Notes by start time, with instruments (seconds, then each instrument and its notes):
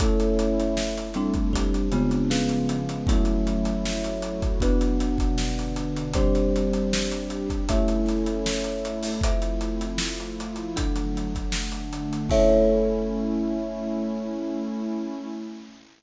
0.00 pad 2 (warm) A3 C#4 E4, marimba A3 C#4 E4, kalimba A4 C#5 E5, kick, closed hi-hat
0.20 closed hi-hat
0.39 closed hi-hat
0.60 closed hi-hat
0.77 pad 2 (warm) A3 E4 A4, snare
0.97 snare, closed hi-hat
1.14 marimba G3 C4 D4, closed hi-hat
1.34 kick, closed hi-hat
1.52 pad 2 (warm) G3 C4 D4, kalimba G4 C5 D5, kick, closed hi-hat
1.74 closed hi-hat
1.92 marimba C#3 G#3 B3 F4, closed hi-hat
2.11 closed hi-hat
2.30 pad 2 (warm) C#3 F3 G#3 B3, kalimba C#4 G#4 B4 F5, snare
2.49 closed hi-hat
2.69 closed hi-hat
2.89 closed hi-hat
3.07 marimba F#3 A3 C#4 E4, pad 2 (warm) F#3 A3 C#4 E4, kalimba F#4 A4 C#5 E5, kick, closed hi-hat
3.25 closed hi-hat
3.47 closed hi-hat
3.65 closed hi-hat
3.85 pad 2 (warm) F#3 A3 E4 F#4, snare
4.04 closed hi-hat
4.22 closed hi-hat
4.42 kick, closed hi-hat
4.60 pad 2 (warm) B2 F#3 D4, marimba B3 D4 F#4, kalimba B4 D5 F#5, kick, closed hi-hat
4.81 closed hi-hat
5.00 closed hi-hat
5.18 kick, closed hi-hat
5.38 pad 2 (warm) B2 D3 D4, snare
5.58 snare, closed hi-hat
5.76 closed hi-hat
5.96 closed hi-hat
6.13 marimba G3 C4 D4, pad 2 (warm) G3 C4 D4, kalimba G4 C5 D5, kick, closed hi-hat
6.35 closed hi-hat
6.56 closed hi-hat
6.73 closed hi-hat
6.93 pad 2 (warm) G3 D4 G4, snare
7.11 closed hi-hat
7.30 closed hi-hat
7.50 kick, closed hi-hat
7.69 marimba A3 C#4 E4, pad 2 (warm) A3 C#4 E4, kalimba A4 C#5 E5, kick, closed hi-hat
7.88 closed hi-hat
8.06 snare, closed hi-hat
8.26 closed hi-hat
8.46 pad 2 (warm) A3 E4 A4, snare
8.64 closed hi-hat
8.85 closed hi-hat
9.03 open hi-hat
9.21 pad 2 (warm) F3 A3 C4 E4, kalimba F4 A4 C5 E5, kick, closed hi-hat
9.42 closed hi-hat
9.61 closed hi-hat
9.81 closed hi-hat
9.98 pad 2 (warm) F3 A3 E4 F4, snare
10.20 closed hi-hat
10.40 closed hi-hat
10.56 closed hi-hat
10.76 pad 2 (warm) D3 F#3 A3, kalimba D4 A4 F#5, kick, closed hi-hat
10.96 closed hi-hat
11.17 closed hi-hat
11.35 kick, closed hi-hat
11.52 pad 2 (warm) D3 A3 D4, snare
11.72 closed hi-hat
11.93 closed hi-hat
12.13 closed hi-hat
12.29 marimba A3 C#4 E4, pad 2 (warm) A3 C#4 E4, kalimba A4 C#5 E5, kick, crash